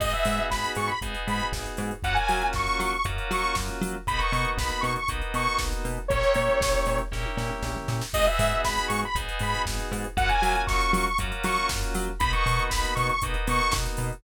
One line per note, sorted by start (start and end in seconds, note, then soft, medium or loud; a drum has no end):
0.00 0.14 G#1 medium
0.00 0.92 B3 medium
0.00 0.92 D#4 loud
0.00 0.92 F#4 loud
0.00 0.92 G#4 loud
0.00 0.12 D#5 medium
0.00 kick loud
0.00 crash loud
0.13 0.46 E5 medium
0.13 closed hi-hat medium
0.25 0.40 G#2 medium
0.25 open hi-hat loud
0.38 closed hi-hat medium
0.50 0.65 G#1 loud
0.50 0.73 B5 medium
0.50 kick medium
0.50 snare loud
0.64 closed hi-hat medium
0.75 0.90 G#2 medium
0.75 0.89 C#6 medium
0.75 open hi-hat medium
0.87 0.99 B5 medium
0.87 closed hi-hat medium
1.01 1.15 G#1 medium
1.01 1.93 B3 medium
1.01 1.93 D#4 medium
1.01 1.93 F#4 medium
1.01 1.93 G#4 medium
1.01 kick medium
1.01 closed hi-hat loud
1.15 closed hi-hat medium
1.27 1.41 G#2 medium
1.27 1.48 B5 medium
1.27 open hi-hat medium
1.39 closed hi-hat medium
1.53 1.67 G#1 medium
1.53 kick medium
1.53 snare loud
1.66 closed hi-hat medium
1.77 1.92 G#2 medium
1.77 open hi-hat medium
1.91 closed hi-hat medium
2.03 2.17 F#2 loud
2.03 2.95 A#3 loud
2.03 2.95 C#4 loud
2.03 2.95 F4 loud
2.03 2.95 F#4 loud
2.03 2.16 F#5 medium
2.03 kick loud
2.03 closed hi-hat loud
2.14 2.48 G#5 medium
2.14 closed hi-hat medium
2.28 2.43 F#3 medium
2.28 open hi-hat medium
2.41 closed hi-hat medium
2.53 2.68 F#2 medium
2.53 2.80 C#6 medium
2.53 kick loud
2.53 snare medium
2.67 closed hi-hat medium
2.80 2.94 F#3 medium
2.80 2.91 C#6 medium
2.80 open hi-hat medium
2.92 3.04 C#6 medium
2.92 closed hi-hat medium
3.04 3.19 F#2 medium
3.04 3.97 A#3 medium
3.04 3.97 C#4 medium
3.04 3.97 F4 medium
3.04 3.97 F#4 medium
3.04 kick loud
3.04 closed hi-hat loud
3.18 closed hi-hat medium
3.31 3.45 F#3 medium
3.31 3.56 C#6 medium
3.31 open hi-hat medium
3.43 closed hi-hat medium
3.55 3.70 F#2 medium
3.55 kick loud
3.55 snare loud
3.68 closed hi-hat medium
3.81 3.95 F#3 loud
3.81 open hi-hat medium
3.94 closed hi-hat medium
4.07 4.21 B1 medium
4.07 4.99 A#3 loud
4.07 4.99 B3 loud
4.07 4.99 D#4 loud
4.07 4.99 F#4 loud
4.07 4.20 B5 medium
4.07 kick loud
4.07 closed hi-hat loud
4.18 4.49 C#6 medium
4.18 closed hi-hat medium
4.32 4.46 B2 medium
4.32 open hi-hat medium
4.45 closed hi-hat medium
4.58 4.72 B1 medium
4.58 4.83 B5 medium
4.58 kick loud
4.58 snare loud
4.69 closed hi-hat medium
4.81 4.97 B2 medium
4.81 4.93 C#6 medium
4.81 open hi-hat medium
4.96 5.09 C#6 medium
4.96 closed hi-hat medium
5.08 5.23 B1 medium
5.08 6.00 A#3 medium
5.08 6.00 B3 medium
5.08 6.00 D#4 medium
5.08 6.00 F#4 medium
5.08 kick loud
5.08 closed hi-hat loud
5.21 closed hi-hat medium
5.34 5.48 B2 medium
5.34 5.60 C#6 medium
5.34 open hi-hat medium
5.47 closed hi-hat medium
5.59 5.73 B1 medium
5.59 kick loud
5.59 snare loud
5.72 closed hi-hat medium
5.85 5.99 B2 medium
5.85 open hi-hat medium
5.97 closed hi-hat medium
6.08 6.24 A#1 loud
6.08 7.02 A#3 loud
6.08 7.02 C#4 loud
6.08 7.02 E4 medium
6.08 7.02 G4 loud
6.08 6.99 C#5 medium
6.08 kick loud
6.08 closed hi-hat loud
6.23 closed hi-hat medium
6.34 6.49 A#2 medium
6.34 open hi-hat medium
6.49 closed hi-hat medium
6.61 6.75 A#1 medium
6.61 kick loud
6.61 snare loud
6.74 closed hi-hat medium
6.86 7.01 A#2 medium
6.86 open hi-hat medium
6.98 closed hi-hat medium
7.12 7.26 A#1 medium
7.12 8.03 A#3 loud
7.12 8.03 C#4 loud
7.12 8.03 E4 medium
7.12 8.03 G4 medium
7.12 kick medium
7.12 snare medium
7.25 high tom medium
7.37 7.51 A#2 medium
7.37 snare medium
7.50 mid tom medium
7.63 7.77 A#1 medium
7.63 snare medium
7.75 floor tom medium
7.88 8.02 A#2 medium
7.88 snare medium
8.01 snare loud
8.13 8.28 G#1 loud
8.13 9.05 B3 loud
8.13 9.05 D#4 loud
8.13 9.05 F#4 loud
8.13 9.05 G#4 loud
8.13 8.26 D#5 loud
8.13 kick loud
8.13 crash loud
8.26 8.61 E5 medium
8.26 closed hi-hat medium
8.39 8.53 G#2 loud
8.39 open hi-hat loud
8.51 closed hi-hat medium
8.65 8.79 G#1 loud
8.65 8.87 B5 medium
8.65 kick medium
8.65 snare loud
8.77 closed hi-hat medium
8.88 9.04 G#2 medium
8.88 9.00 C#6 medium
8.88 open hi-hat loud
9.02 9.17 B5 medium
9.02 closed hi-hat medium
9.15 9.29 G#1 loud
9.15 10.07 B3 medium
9.15 10.07 D#4 loud
9.15 10.07 F#4 medium
9.15 10.07 G#4 medium
9.15 kick loud
9.15 closed hi-hat loud
9.28 closed hi-hat medium
9.39 9.55 G#2 loud
9.39 9.62 B5 medium
9.39 open hi-hat medium
9.54 closed hi-hat medium
9.65 9.80 G#1 loud
9.65 kick loud
9.65 snare loud
9.79 closed hi-hat medium
9.92 10.06 G#2 loud
9.92 open hi-hat medium
10.04 closed hi-hat medium
10.17 10.31 F#2 loud
10.17 11.08 A#3 loud
10.17 11.08 C#4 loud
10.17 11.08 F4 loud
10.17 11.08 F#4 loud
10.17 10.29 F#5 loud
10.17 kick loud
10.17 closed hi-hat loud
10.29 10.63 G#5 medium
10.29 closed hi-hat medium
10.42 10.56 F#3 medium
10.42 open hi-hat medium
10.55 closed hi-hat medium
10.67 10.82 F#2 loud
10.67 10.91 C#6 medium
10.67 kick loud
10.67 snare loud
10.81 closed hi-hat medium
10.93 11.07 F#3 medium
10.93 11.05 C#6 medium
10.93 open hi-hat loud
11.06 11.18 C#6 medium
11.06 closed hi-hat medium
11.18 11.33 F#2 medium
11.18 12.11 A#3 loud
11.18 12.11 C#4 medium
11.18 12.11 F4 medium
11.18 12.11 F#4 loud
11.18 kick loud
11.18 closed hi-hat loud
11.32 closed hi-hat medium
11.44 11.58 F#3 loud
11.44 11.69 C#6 medium
11.44 open hi-hat loud
11.56 closed hi-hat medium
11.69 11.84 F#2 loud
11.69 kick loud
11.69 snare loud
11.83 closed hi-hat medium
11.94 12.09 F#3 loud
11.94 open hi-hat loud
12.07 closed hi-hat medium
12.19 12.34 B1 loud
12.19 13.12 A#3 loud
12.19 13.12 B3 loud
12.19 13.12 D#4 loud
12.19 13.12 F#4 loud
12.19 12.32 B5 loud
12.19 kick loud
12.19 closed hi-hat loud
12.33 12.64 C#6 medium
12.33 closed hi-hat medium
12.46 12.60 B2 medium
12.46 open hi-hat medium
12.59 closed hi-hat medium
12.69 12.85 B1 loud
12.69 12.94 B5 medium
12.69 kick loud
12.69 snare loud
12.85 closed hi-hat medium
12.95 13.11 B2 loud
12.95 13.07 C#6 medium
12.95 open hi-hat medium
13.09 13.21 C#6 medium
13.09 closed hi-hat medium
13.22 13.36 B1 loud
13.22 14.14 A#3 loud
13.22 14.14 B3 medium
13.22 14.14 D#4 loud
13.22 14.14 F#4 medium
13.22 kick loud
13.22 closed hi-hat loud
13.34 closed hi-hat medium
13.47 13.61 B2 medium
13.47 13.73 C#6 medium
13.47 open hi-hat loud
13.60 closed hi-hat medium
13.72 13.87 B1 loud
13.72 kick loud
13.72 snare loud
13.85 closed hi-hat medium
13.97 14.12 B2 medium
13.97 open hi-hat medium
14.12 closed hi-hat medium